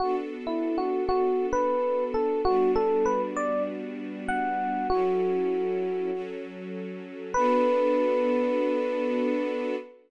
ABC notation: X:1
M:4/4
L:1/16
Q:"Swing 16ths" 1/4=98
K:Bm
V:1 name="Electric Piano 1"
F z2 E2 F2 F3 B4 A2 | F2 A2 B z d2 z4 f4 | F10 z6 | B16 |]
V:2 name="String Ensemble 1"
[B,DFA]16 | [G,B,DF]16 | [F,CEA]8 [F,CFA]8 | [B,DFA]16 |]